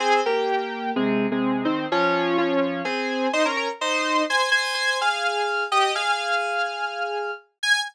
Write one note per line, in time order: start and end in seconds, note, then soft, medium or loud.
0.00 0.20 C4 medium
0.00 0.20 G#4 medium
0.26 0.91 A#3 medium
0.26 0.91 G4 medium
0.96 1.27 C3 medium
0.96 1.27 G#3 medium
1.31 1.64 C3 medium
1.31 1.64 G#3 medium
1.65 1.86 D#3 medium
1.65 1.86 C4 medium
1.92 2.37 F3 medium
1.92 2.37 C#4 medium
2.38 2.82 F3 medium
2.38 2.82 C#4 medium
2.85 3.28 C4 medium
2.85 3.28 G#4 medium
3.33 3.45 D#4 medium
3.33 3.45 C5 medium
3.45 3.56 C#4 medium
3.45 3.56 A#4 medium
3.57 3.68 C#4 medium
3.57 3.68 A#4 medium
3.81 4.22 D#4 medium
3.81 4.22 C5 medium
4.30 4.49 C5 medium
4.30 4.49 G#5 medium
4.51 4.74 C5 medium
4.51 4.74 G#5 medium
4.74 4.97 C5 medium
4.74 4.97 G#5 medium
5.01 5.64 G#4 medium
5.01 5.64 F5 medium
5.72 5.92 G4 medium
5.72 5.92 D#5 medium
5.95 7.31 G#4 medium
5.95 7.31 F5 medium
7.63 7.79 G#5 loud